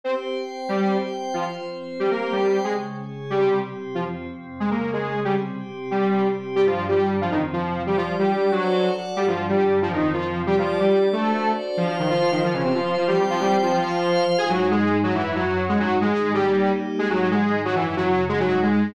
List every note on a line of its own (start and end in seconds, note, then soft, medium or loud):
0.04 0.35 C4 medium
0.04 0.14 C4 medium
0.04 0.36 G4 medium
0.04 0.35 C5 medium
0.04 0.14 C5 medium
0.36 0.68 C4 medium
0.36 0.68 C5 medium
0.36 0.68 G5 medium
0.69 0.97 G3 medium
0.69 1.01 C4 medium
0.69 0.97 G4 loud
0.69 1.02 G4 medium
0.69 1.01 C5 medium
1.02 1.34 C4 medium
1.02 1.33 C5 medium
1.02 1.34 G5 medium
1.33 1.65 F3 medium
1.33 1.44 F3 medium
1.33 1.65 F4 medium
1.33 1.44 F4 medium
1.33 1.65 C5 medium
1.66 1.98 F3 medium
1.66 1.98 C4 medium
1.66 1.98 C5 medium
2.00 2.10 G3 medium
2.00 2.32 C4 medium
2.00 2.10 G4 medium
2.00 2.32 G4 medium
2.00 2.32 C5 medium
2.11 2.32 A#3 medium
2.11 2.32 A#4 medium
2.32 2.59 G3 medium
2.32 2.65 C4 medium
2.32 2.59 G4 medium
2.32 2.65 C5 medium
2.32 2.65 G5 medium
2.64 2.96 C#3 medium
2.64 2.73 G#3 medium
2.64 2.96 G#3 medium
2.64 2.96 C#4 medium
2.64 2.73 G#4 medium
2.96 3.28 C#3 medium
2.96 3.28 C#4 medium
2.96 3.28 G#4 medium
3.29 3.61 C3 medium
3.29 3.62 G3 medium
3.29 3.59 G3 medium
3.29 3.61 C4 medium
3.29 3.59 G4 loud
3.61 3.94 C3 medium
3.61 3.94 C4 medium
3.61 3.94 G4 medium
3.95 4.27 F2 medium
3.95 4.04 F3 medium
3.95 4.27 F3 medium
3.95 4.27 C4 medium
3.95 4.04 F4 medium
4.27 4.59 F2 medium
4.27 4.59 C3 medium
4.27 4.59 C4 medium
4.60 4.92 C#3 medium
4.60 4.69 G#3 medium
4.60 4.92 G#3 medium
4.60 4.92 C#4 medium
4.60 4.69 G#4 medium
4.71 4.91 A#3 medium
4.71 4.91 A#4 medium
4.93 5.26 C#3 medium
4.93 5.20 G#3 medium
4.93 5.26 C#4 medium
4.93 5.20 G#4 medium
4.93 5.26 G#4 medium
5.24 5.57 C3 medium
5.24 5.35 G3 medium
5.24 5.59 G3 medium
5.24 5.57 C4 medium
5.24 5.35 G4 loud
5.57 5.90 C3 medium
5.57 5.90 C4 medium
5.57 5.90 G4 medium
5.91 6.23 C3 medium
5.91 6.27 G3 medium
5.91 6.23 G3 medium
5.91 6.23 C4 medium
5.91 6.27 G4 medium
6.23 6.56 C3 medium
6.23 6.56 C4 medium
6.23 6.56 G4 medium
6.55 6.87 G2 medium
6.55 6.88 G3 medium
6.55 6.65 G3 loud
6.55 6.87 D4 medium
6.55 6.65 G4 loud
6.66 6.86 F3 medium
6.66 6.86 F4 medium
6.88 7.20 G2 medium
6.88 7.20 D3 medium
6.88 7.15 G3 medium
6.88 7.20 D4 medium
6.88 7.15 G4 medium
7.21 7.53 F2 medium
7.21 7.32 F3 medium
7.21 7.54 F3 medium
7.21 7.53 C4 medium
7.21 7.32 F4 loud
7.31 7.42 D#3 medium
7.31 7.42 D#4 loud
7.53 7.85 F2 medium
7.53 7.85 C3 medium
7.53 7.83 F3 medium
7.53 7.85 C4 medium
7.53 7.83 F4 medium
7.86 8.17 G3 medium
7.86 7.96 G3 medium
7.86 8.18 G4 medium
7.86 7.96 G4 loud
7.86 8.17 D5 medium
7.97 8.15 F3 medium
7.97 8.15 F4 loud
8.18 8.50 G3 medium
8.18 8.51 G3 medium
8.18 8.50 D4 medium
8.18 8.51 G4 loud
8.18 8.50 D5 medium
8.52 8.89 F#3 medium
8.52 8.89 F#4 loud
8.52 8.83 F#4 medium
8.52 8.83 A4 medium
8.52 8.84 C5 medium
8.52 8.83 D5 medium
8.84 9.16 F#4 medium
8.84 9.16 A4 medium
8.84 9.16 D5 medium
8.84 9.16 F#5 medium
9.16 9.48 G2 medium
9.16 9.26 G3 loud
9.16 9.49 G3 medium
9.16 9.48 D4 medium
9.16 9.26 G4 loud
9.28 9.46 F3 medium
9.28 9.46 F4 loud
9.49 9.81 G2 medium
9.49 9.81 D3 medium
9.49 9.79 G3 medium
9.49 9.81 D4 medium
9.49 9.79 G4 medium
9.81 10.13 F2 medium
9.81 10.13 F3 medium
9.81 9.92 F3 medium
9.81 10.13 C4 medium
9.81 9.92 F4 loud
9.93 10.13 D#3 medium
9.93 10.13 D#4 loud
10.14 10.47 F2 medium
10.14 10.47 C3 medium
10.14 10.42 F3 medium
10.14 10.47 C4 medium
10.14 10.42 F4 loud
10.47 10.56 G3 loud
10.47 10.79 G3 medium
10.47 10.56 G4 loud
10.47 10.80 G4 medium
10.47 10.79 D5 medium
10.58 10.78 F3 medium
10.58 10.78 F4 loud
10.80 11.08 G3 medium
10.80 11.12 G3 medium
10.80 11.11 D4 medium
10.80 11.08 G4 medium
10.80 11.12 D5 medium
11.12 11.51 A3 medium
11.12 11.44 D4 medium
11.12 11.44 F#4 medium
11.12 11.44 A4 medium
11.12 11.51 A4 loud
11.12 11.44 C5 medium
11.44 11.76 D4 medium
11.44 11.76 F#4 medium
11.44 11.76 C5 medium
11.44 11.76 D5 medium
11.76 11.87 F3 loud
11.76 12.41 F4 medium
11.76 11.87 F4 loud
11.76 12.41 C5 medium
11.76 12.41 F5 medium
11.88 11.97 F3 medium
11.88 11.97 F4 loud
11.99 12.09 D#3 medium
11.99 12.09 D#4 medium
12.10 12.30 F3 medium
12.10 12.30 F4 loud
12.31 12.42 D#3 medium
12.31 12.42 D#4 medium
12.42 13.07 F3 medium
12.42 12.54 F3 medium
12.42 13.07 F4 medium
12.42 12.54 F4 loud
12.42 13.07 C5 medium
12.53 12.62 C#3 medium
12.53 12.62 C#4 loud
12.64 12.73 C3 medium
12.64 12.73 C4 medium
12.74 12.95 F3 medium
12.74 12.95 F4 medium
12.97 13.07 F3 medium
12.97 13.07 F4 medium
13.07 13.17 G3 medium
13.07 13.73 C4 medium
13.07 13.17 G4 loud
13.07 13.73 C5 medium
13.07 13.73 G5 medium
13.18 13.27 G3 medium
13.18 13.27 G4 medium
13.30 13.40 F3 loud
13.30 13.40 F4 loud
13.40 13.58 G3 medium
13.40 13.58 G4 loud
13.63 13.72 F3 medium
13.63 13.72 F4 medium
13.73 14.24 F3 loud
13.73 14.24 F4 loud
13.73 14.38 F4 medium
13.73 14.38 C5 loud
13.73 14.38 F5 medium
14.38 15.03 G#2 medium
14.38 15.03 G#3 medium
14.38 15.03 D#4 medium
14.38 14.48 G#4 loud
14.38 14.48 G#5 loud
14.50 14.69 F#3 loud
14.50 14.69 F#4 loud
14.71 14.98 G#3 loud
14.71 14.98 G#4 loud
15.03 15.68 F#2 medium
15.03 15.14 F#3 loud
15.03 15.68 F#3 medium
15.03 15.68 C#4 medium
15.03 15.14 F#4 loud
15.15 15.35 E3 loud
15.15 15.35 E4 loud
15.35 15.65 F#3 loud
15.35 15.65 F#4 loud
15.68 16.01 G#2 medium
15.68 16.01 G#3 medium
15.68 15.78 G#3 loud
15.68 16.01 D#4 medium
15.68 15.78 G#4 loud
15.79 15.97 F#3 loud
15.79 15.97 F#4 loud
16.01 16.34 G#2 medium
16.01 16.34 D#3 medium
16.01 16.33 G#3 loud
16.01 16.33 D#4 medium
16.01 16.33 G#4 loud
16.33 16.66 G3 medium
16.33 16.71 G3 loud
16.33 16.66 A#3 medium
16.33 16.66 C#4 medium
16.33 16.66 D#4 medium
16.33 16.71 G4 loud
16.67 16.99 G3 medium
16.67 16.99 A#3 medium
16.67 16.98 D#4 medium
16.67 16.99 G4 medium
16.99 17.31 G#2 medium
16.99 17.08 G#3 loud
16.99 17.31 G#3 medium
16.99 17.31 D#4 medium
16.99 17.08 G#4 loud
17.10 17.28 F#3 loud
17.10 17.28 F#4 loud
17.31 17.64 G#2 medium
17.31 17.64 D#3 medium
17.31 17.62 G#3 loud
17.31 17.64 D#4 medium
17.31 17.62 G#4 loud
17.65 17.97 F#2 medium
17.65 17.75 F#3 loud
17.65 17.97 F#3 medium
17.65 17.97 C#4 medium
17.65 17.75 F#4 loud
17.75 17.95 E3 loud
17.75 17.95 E4 loud
17.97 18.30 F#2 medium
17.97 18.30 C#3 medium
17.97 18.25 F#3 loud
17.97 18.30 C#4 medium
17.97 18.25 F#4 loud
18.29 18.94 G#2 medium
18.29 18.94 G#3 medium
18.29 18.39 G#3 loud
18.29 18.94 D#4 medium
18.29 18.39 G#4 loud
18.40 18.60 F#3 loud
18.40 18.60 F#4 loud
18.62 18.91 G#3 medium
18.62 18.91 G#4 loud